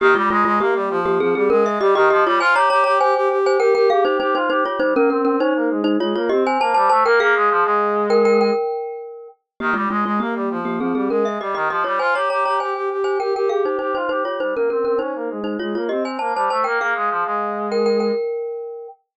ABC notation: X:1
M:4/4
L:1/16
Q:1/4=100
K:Ab
V:1 name="Glockenspiel"
[B,G] [A,F] [A,F] [A,F] [B,G]3 [B,G] [CA] [CA] [DB] _f [Ge] [Ge] [Ge] [=Fd] | [ca] [db] [db] [db] [ca]3 [ca] [Bg] [Bg] [Af] [Ec] [Ec] [Ec] [Ec] [Fd] | [Ec] [DB] [DB] [DB] [Ec]3 [Ec] [Fd] [Fd] [Ge] [ca] [c=a] [ca] [ca] [Bg] | [Af]6 [Bg] [Bg] [Bg]6 z2 |
[B,G] [A,F] [A,F] [A,F] [B,G]3 [B,G] [CA] [CA] [DB] _f [Ge] [Ge] [Ge] [=Fd] | [ca] [db] [db] [db] [ca]3 [ca] [Bg] [Bg] [Af] [Ec] [Ec] [Ec] [Ec] [Fd] | [Ec] [DB] [DB] [DB] [Ec]3 [Ec] [Fd] [Fd] [Ge] [ca] [c=a] [ca] [ca] [Bg] | [Af]6 [Bg] [Bg] [Bg]6 z2 |]
V:2 name="Brass Section"
E, G, A, A, B, G, F,2 F, G, A,2 G, E, F, G, | F G G G G G G2 G G G2 G F G G | G, B, C C D B, A,2 A, B, C2 B, G, =A, B, | B, A, F, A,7 z6 |
E, G, A, A, B, G, F,2 F, G, A,2 G, E, F, G, | F G G G G G G2 G G G2 G F G G | G, B, C C D B, A,2 A, B, C2 B, G, =A, B, | B, A, F, A,7 z6 |]